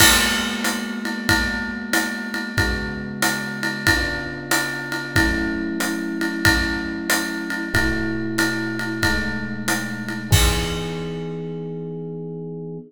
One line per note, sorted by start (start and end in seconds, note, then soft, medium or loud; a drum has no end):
0.00 2.53 G#3 loud
0.00 2.53 A#3 loud
0.00 2.53 B3 loud
0.00 2.53 F#4 loud
0.00 kick medium
0.00 crash loud
0.00 ride loud
0.64 hi-hat pedal loud
0.64 ride medium
1.05 ride medium
1.29 kick medium
1.29 ride loud
1.93 hi-hat pedal loud
1.93 ride loud
2.34 ride medium
2.58 3.86 C#3 loud
2.58 3.86 G#3 loud
2.58 3.86 B3 loud
2.58 3.86 F#4 loud
2.58 kick medium
2.58 ride loud
3.22 hi-hat pedal loud
3.22 ride loud
3.63 ride medium
3.87 5.14 C#3 loud
3.87 5.14 B3 loud
3.87 5.14 D4 loud
3.87 5.14 F4 loud
3.87 kick medium
3.87 ride loud
4.51 hi-hat pedal loud
4.51 ride loud
4.92 ride medium
5.15 7.70 F#3 loud
5.15 7.70 A3 medium
5.15 7.70 C#4 loud
5.15 7.70 E4 loud
5.15 kick medium
5.15 ride loud
5.80 hi-hat pedal medium
5.80 ride medium
6.21 ride medium
6.45 kick medium
6.45 ride loud
7.10 hi-hat pedal loud
7.10 ride loud
7.50 ride medium
7.74 9.01 B2 loud
7.74 9.01 A3 loud
7.74 9.01 E4 loud
7.74 9.01 F#4 loud
7.74 kick medium
7.74 ride loud
8.38 hi-hat pedal medium
8.38 ride loud
8.79 ride medium
9.03 10.31 B2 medium
9.03 10.31 G#3 medium
9.03 10.31 A3 medium
9.03 10.30 D#4 medium
9.03 kick medium
9.03 ride loud
9.68 hi-hat pedal loud
9.68 ride loud
10.08 ride medium
10.31 12.78 E3 loud
10.31 12.78 B3 loud
10.31 12.78 D#4 medium
10.31 12.78 G#4 loud
10.31 kick loud
10.31 crash loud